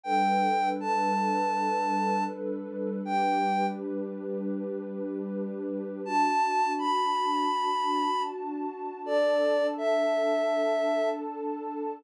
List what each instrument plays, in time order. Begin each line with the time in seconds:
0.03 pad 2 (warm) G3 D4 A4 B4, ocarina G5
0.80 ocarina A5
3.05 pad 2 (warm) G3 D4 G4 B4, ocarina G5
6.04 pad 2 (warm) D4 F#4 A5, ocarina A5
6.78 ocarina B5
9.04 pad 2 (warm) D4 A4 A5, ocarina D5
9.78 ocarina E5